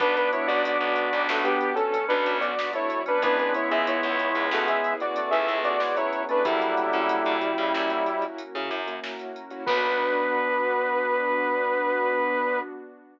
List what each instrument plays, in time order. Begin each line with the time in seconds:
0.00 electric bass (finger) B1, acoustic grand piano B3 D4 F#4, drawbar organ B3 D4, pad 2 (warm) B3 D4 F#4, lead 2 (sawtooth) D4 B4, kick, closed hi-hat
0.16 lead 2 (sawtooth) D4 B4, closed hi-hat
0.33 lead 2 (sawtooth) E4 C#5, closed hi-hat
0.47 electric bass (finger) B1, acoustic grand piano B3 D4 F#4, lead 2 (sawtooth) F#4 D5, closed hi-hat
0.65 lead 2 (sawtooth) F#4 D5, closed hi-hat
0.81 electric bass (finger) B1, closed hi-hat
0.96 closed hi-hat
1.13 electric bass (finger) B1, closed hi-hat
1.29 electric bass (finger) B1, lead 2 (sawtooth) A3 F#4, snare
1.44 lead 2 (sawtooth) B3 G4, acoustic grand piano B3 D4 F#4, closed hi-hat
1.61 pad 2 (warm) F#3 B3 F#4, closed hi-hat
1.75 lead 2 (sawtooth) C#4 A4, closed hi-hat
1.92 drawbar organ C#4, closed hi-hat
2.08 electric bass (finger) B1, acoustic grand piano B3 D4 F#4, lead 2 (sawtooth) D4 B4, closed hi-hat
2.26 electric bass (finger) B1, closed hi-hat
2.40 acoustic grand piano B3 D4 F#4, lead 2 (sawtooth) F#4 D5, closed hi-hat
2.58 drawbar organ B3, snare
2.73 drawbar organ A3, lead 2 (sawtooth) E4 C#5, closed hi-hat
2.90 closed hi-hat
3.06 acoustic grand piano B3 D4 F#4, drawbar organ C#4, lead 2 (sawtooth) D4 B4, closed hi-hat
3.22 electric bass (finger) C#2, drawbar organ G#3 B3, acoustic grand piano B3 C#4 E4 G#4, pad 2 (warm) B3 C#4 E4 G#4, lead 2 (sawtooth) D4 B4, kick, closed hi-hat
3.39 lead 2 (sawtooth) D4 B4, closed hi-hat
3.54 lead 2 (sawtooth) E4 C#5, closed hi-hat
3.70 electric bass (finger) C#2, acoustic grand piano B3 C#4 E4 G#4, lead 2 (sawtooth) G#4 E5, closed hi-hat
3.87 lead 2 (sawtooth) E4 C#5, closed hi-hat
4.03 electric bass (finger) C#2, closed hi-hat
4.19 closed hi-hat
4.35 electric bass (finger) C#2, closed hi-hat
4.51 electric bass (finger) C#2, lead 2 (sawtooth) A3 F#4, snare
4.68 acoustic grand piano B3 C#4 E4 G#4, lead 2 (sawtooth) G#4 E5, closed hi-hat
4.84 pad 2 (warm) B3 C#4 G#4 B4, closed hi-hat
5.00 lead 2 (sawtooth) F#4 D5, closed hi-hat
5.16 drawbar organ A3, closed hi-hat
5.31 electric bass (finger) C#2, acoustic grand piano B3 C#4 E4 G#4, lead 2 (sawtooth) G#4 E5, closed hi-hat
5.48 electric bass (finger) C#2, closed hi-hat
5.64 acoustic grand piano B3 C#4 E4 G#4, lead 2 (sawtooth) F#4 D5, closed hi-hat
5.80 drawbar organ G#3, snare
5.96 drawbar organ F#3, lead 2 (sawtooth) E4 C#5, closed hi-hat
6.13 closed hi-hat
6.29 drawbar organ A3, acoustic grand piano B3 C#4 E4 G#4, lead 2 (sawtooth) D4 B4, closed hi-hat
6.44 electric bass (finger) F#2, drawbar organ D3 F#3, lead 2 (sawtooth) G3 E4, pad 2 (warm) A#3 C#4 E4 F#4, acoustic grand piano A#3 C#4 E4 F#4, kick, closed hi-hat
6.62 closed hi-hat
6.77 closed hi-hat
6.93 electric bass (finger) C#3, acoustic grand piano A#3 C#4 E4 F#4, closed hi-hat
7.09 closed hi-hat
7.26 electric bass (finger) C#3, closed hi-hat
7.41 closed hi-hat
7.58 electric bass (finger) C#3, closed hi-hat
7.74 electric bass (finger) F#2, snare
7.90 acoustic grand piano A#3 C#4 E4 F#4, closed hi-hat
8.06 pad 2 (warm) A#3 C#4 F#4 A#4, closed hi-hat
8.22 closed hi-hat
8.38 closed hi-hat
8.55 electric bass (finger) C#3, acoustic grand piano A#3 C#4 E4 F#4, closed hi-hat
8.71 electric bass (finger) F#2, closed hi-hat
8.87 acoustic grand piano A#3 C#4 E4 F#4, closed hi-hat
9.04 snare
9.19 closed hi-hat
9.36 closed hi-hat
9.51 acoustic grand piano A#3 C#4 E4 F#4, closed hi-hat
9.66 electric bass (finger) B1, acoustic grand piano B3 D4 F#4, drawbar organ B3, pad 2 (warm) B3 D4 F#4, lead 2 (sawtooth) B4, kick, crash